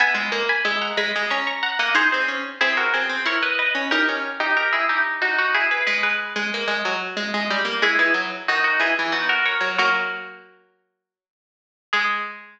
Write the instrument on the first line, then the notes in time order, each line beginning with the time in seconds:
harpsichord
0.00 B3 E5 G#5
0.15 G#3
0.32 A#3
0.49 G#5 B5
0.65 G#3 E5 G#5
0.82 F#5 A#5
0.97 G#3 G#5 B5
1.16 G#3
1.30 C#4 A#5 C#6
1.47 A#5 C#6
1.63 F#5 A#5
1.79 A#3 D#5 F#5
1.95 D#4 G#4 C5
2.12 C4 G#4 C5
2.28 C#4
2.61 C4 E4 G#4
2.77 F#4 A#4
2.94 C4 G#4 C5
3.09 C4
3.26 E4 A#4 C#5
3.43 B4 D#5
3.59 B4 D#5
3.75 C#4
3.91 D#4 G4 A#4
4.09 C#4
4.40 D#4 G4
4.57 G4 A#4
4.73 E4 G#4
4.89 D#4 G4
5.22 D#4 F#4
5.38 D#4 F#4
5.54 E4 G#4
5.71 G#4 B4
5.87 G#3 G#4 B4
6.03 G#4 B4
6.36 G#3
6.54 A#3
6.68 G#3
6.85 F#3
7.17 G#3
7.34 G#3
7.50 G3
7.65 A#3
7.82 G#3 E4 G#4
7.99 E3 E4 G#4
8.14 F#3
8.48 D#3 D#4 F#4
8.64 D#4 F#4
8.79 E3 E4 G#4
8.99 E3
9.12 B3 D#4 F#4
9.29 F#4 A#4
9.46 A#4 C#5
9.61 F#3
9.78 F#3 A#3 F#4 A#4
11.93 G#3 G#4